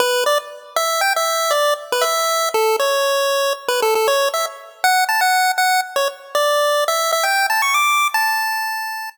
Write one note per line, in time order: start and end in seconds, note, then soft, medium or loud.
0.00 0.24 B4 loud
0.26 0.38 D5 medium
0.76 1.01 E5 medium
1.01 1.13 G5 loud
1.16 1.53 E5 medium
1.51 1.74 D5 medium
1.92 2.04 B4 medium
2.01 2.49 E5 loud
2.54 2.76 A4 medium
2.79 3.53 C#5 medium
3.68 3.81 B4 medium
3.82 3.94 A4 medium
3.95 4.07 A4 medium
4.08 4.29 C#5 loud
4.34 4.46 E5 medium
4.84 5.04 F#5 medium
5.09 5.21 A5 medium
5.21 5.52 F#5 medium
5.58 5.81 F#5 medium
5.96 6.08 C#5 medium
6.35 6.84 D5 medium
6.88 7.11 E5 loud
7.13 7.25 E5 loud
7.23 7.47 G5 medium
7.50 7.62 A5 medium
7.62 7.74 C#6 medium
7.74 8.08 D6 medium
8.14 9.10 A5 loud